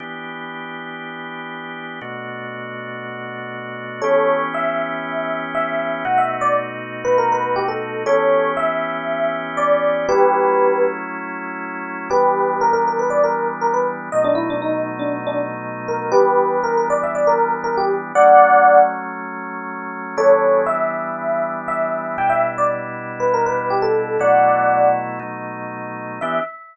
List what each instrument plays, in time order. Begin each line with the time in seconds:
0.00 drawbar organ E3 B3 D4 G4
2.01 drawbar organ B2 A3 D4 F#4
4.02 drawbar organ E3 B3 C#4 G4, electric piano 1 A4 C#5
4.54 electric piano 1 E5
5.55 electric piano 1 E5
6.05 drawbar organ B2 A3 D#4 F#4, electric piano 1 F#5
6.18 electric piano 1 E5
6.41 electric piano 1 D5
7.05 electric piano 1 B4
7.18 electric piano 1 A#4
7.32 electric piano 1 B4
7.56 electric piano 1 G4
7.68 electric piano 1 A4
8.06 drawbar organ E3 B3 C#4 G4, electric piano 1 A4 C#5
8.57 electric piano 1 E5
9.57 electric piano 1 D5
10.09 drawbar organ F#3 A3 C#4 E4, electric piano 1 G4 B4
12.10 drawbar organ E3 G3 B3 D4, electric piano 1 G4 B4
12.61 electric piano 1 A#4
12.73 electric piano 1 A#4
12.88 electric piano 1 A#4
12.99 electric piano 1 B4
13.10 electric piano 1 D5
13.24 electric piano 1 A#4
13.61 electric piano 1 A#4
13.74 electric piano 1 B4
14.12 drawbar organ B2 F#3 A3 D#4, electric piano 1 D#5
14.24 electric piano 1 D4
14.35 electric piano 1 E4
14.50 electric piano 1 D4
14.62 electric piano 1 D#4
14.99 electric piano 1 D4
15.27 electric piano 1 D4
15.88 electric piano 1 A#4
16.12 drawbar organ E3 G3 B3 D4, electric piano 1 G4 B4
16.64 electric piano 1 A#4
16.77 electric piano 1 A#4
16.90 electric piano 1 D5
17.03 electric piano 1 E5
17.15 electric piano 1 D5
17.27 electric piano 1 A#4
17.64 electric piano 1 A#4
17.78 electric piano 1 G4
18.15 drawbar organ F#3 A3 C#4, electric piano 1 D5 F#5
20.17 drawbar organ E3 G3 B3 D4, electric piano 1 A4 C#5
20.66 electric piano 1 E5
21.68 electric piano 1 E5
22.18 drawbar organ B2 G3 D4 E4, electric piano 1 G5
22.30 electric piano 1 E5
22.58 electric piano 1 D5
23.20 electric piano 1 B4
23.34 electric piano 1 A#4
23.46 electric piano 1 B4
23.70 electric piano 1 G4
23.82 electric piano 1 A4
24.19 drawbar organ B2 F#3 A3 E4, electric piano 1 D5 F#5
25.19 drawbar organ B2 F#3 A3 D#4
26.21 drawbar organ E3 B3 D4 G4, electric piano 1 E5